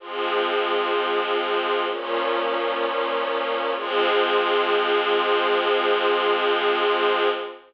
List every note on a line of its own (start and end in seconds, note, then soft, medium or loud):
0.00 1.86 F3 medium
0.00 1.86 G#3 medium
0.00 1.86 C4 medium
1.87 3.73 A#2 medium
1.87 3.73 F3 medium
1.87 3.73 C#4 medium
3.75 7.28 F3 loud
3.75 7.28 G#3 loud
3.75 7.28 C4 loud